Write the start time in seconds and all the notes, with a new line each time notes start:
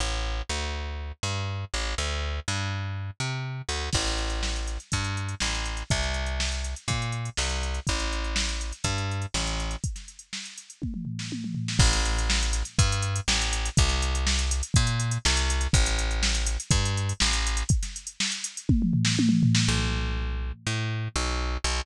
0.00 A1
0.49 D2
1.23 G2
1.74 A1
1.98 D2
2.48 G2
3.20 C3
3.69 D2
3.93 A1, kick, crash
4.06 snare, closed hi-hat
4.18 closed hi-hat
4.30 closed hi-hat
4.43 snare
4.56 closed hi-hat
4.67 snare, closed hi-hat
4.80 closed hi-hat
4.92 G2, kick, closed hi-hat
5.04 closed hi-hat
5.17 closed hi-hat
5.29 closed hi-hat
5.40 A1, snare
5.55 closed hi-hat
5.65 closed hi-hat
5.77 closed hi-hat
5.90 C2, kick, closed hi-hat
6.03 snare, closed hi-hat
6.14 closed hi-hat
6.26 closed hi-hat
6.40 snare
6.52 closed hi-hat
6.64 closed hi-hat
6.76 closed hi-hat
6.88 A#2, kick, closed hi-hat
7.02 closed hi-hat
7.12 closed hi-hat
7.25 closed hi-hat
7.37 C2, snare
7.49 closed hi-hat
7.63 closed hi-hat
7.74 closed hi-hat
7.87 A1, kick, closed hi-hat
7.99 snare, closed hi-hat
8.12 closed hi-hat
8.24 closed hi-hat
8.36 snare
8.48 snare, closed hi-hat
8.61 closed hi-hat
8.72 closed hi-hat
8.84 G2, kick, closed hi-hat
8.98 closed hi-hat
9.11 closed hi-hat
9.22 closed hi-hat
9.34 A1, snare
9.46 snare, closed hi-hat
9.60 closed hi-hat
9.71 closed hi-hat
9.84 kick, closed hi-hat
9.96 snare, closed hi-hat
10.08 closed hi-hat
10.19 closed hi-hat
10.33 snare
10.45 closed hi-hat
10.58 closed hi-hat
10.70 closed hi-hat
10.82 kick, high tom
10.94 mid tom
11.05 floor tom
11.19 snare
11.32 high tom
11.44 mid tom
11.55 floor tom
11.68 snare
11.79 A1, kick, crash
11.93 snare, closed hi-hat
12.05 closed hi-hat
12.18 closed hi-hat
12.30 snare
12.43 closed hi-hat
12.53 snare, closed hi-hat
12.65 closed hi-hat
12.78 G2, kick, closed hi-hat
12.92 closed hi-hat
13.02 closed hi-hat
13.16 closed hi-hat
13.28 A1, snare
13.42 closed hi-hat
13.53 closed hi-hat
13.65 closed hi-hat
13.77 C2, kick, closed hi-hat
13.89 snare, closed hi-hat
14.02 closed hi-hat
14.15 closed hi-hat
14.27 snare
14.39 closed hi-hat
14.51 closed hi-hat
14.63 closed hi-hat
14.74 A#2, kick, closed hi-hat
14.87 closed hi-hat
15.00 closed hi-hat
15.11 closed hi-hat
15.25 C2, snare
15.37 closed hi-hat
15.50 closed hi-hat
15.61 closed hi-hat
15.73 A1, kick, closed hi-hat
15.86 snare, closed hi-hat
15.99 closed hi-hat
16.11 closed hi-hat
16.23 snare
16.35 snare, closed hi-hat
16.47 closed hi-hat
16.60 closed hi-hat
16.71 G2, kick, closed hi-hat
16.85 closed hi-hat
16.97 closed hi-hat
17.09 closed hi-hat
17.20 A1, snare
17.33 snare, closed hi-hat
17.47 closed hi-hat
17.57 closed hi-hat
17.69 kick, closed hi-hat
17.83 snare, closed hi-hat
17.96 closed hi-hat
18.07 closed hi-hat
18.20 snare
18.32 closed hi-hat
18.44 closed hi-hat
18.57 closed hi-hat
18.69 kick, high tom
18.82 mid tom
18.93 floor tom
19.05 snare
19.19 high tom
19.29 mid tom
19.43 floor tom
19.55 snare
19.68 B1
20.67 A2
21.16 B1
21.64 B1